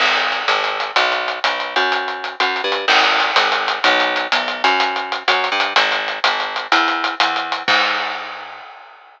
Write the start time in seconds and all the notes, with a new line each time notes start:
0.00 G#1, crash
0.16 closed hi-hat
0.32 closed hi-hat
0.48 G#1, closed hi-hat
0.64 closed hi-hat
0.80 closed hi-hat
0.96 B1, closed hi-hat
1.12 closed hi-hat
1.28 closed hi-hat
1.44 B1, closed hi-hat
1.60 closed hi-hat
1.76 F#2, closed hi-hat
1.92 closed hi-hat
2.08 closed hi-hat
2.24 closed hi-hat
2.40 F#2, closed hi-hat
2.56 closed hi-hat
2.64 G2
2.72 closed hi-hat
2.88 G#1, crash
3.04 closed hi-hat
3.20 closed hi-hat
3.36 G#1, closed hi-hat
3.52 closed hi-hat
3.68 closed hi-hat
3.84 B1, closed hi-hat
4.00 closed hi-hat
4.16 closed hi-hat
4.32 B1, closed hi-hat
4.48 closed hi-hat
4.64 F#2, closed hi-hat
4.80 closed hi-hat
4.96 closed hi-hat
5.12 closed hi-hat
5.28 F#2, closed hi-hat
5.44 closed hi-hat
5.52 G2
5.60 closed hi-hat
5.76 G#1, closed hi-hat
5.92 closed hi-hat
6.08 closed hi-hat
6.24 G#1, closed hi-hat
6.40 closed hi-hat
6.56 closed hi-hat
6.72 E2, closed hi-hat
6.88 closed hi-hat
7.04 closed hi-hat
7.20 E2, closed hi-hat
7.36 closed hi-hat
7.52 closed hi-hat
7.68 G#2, kick, crash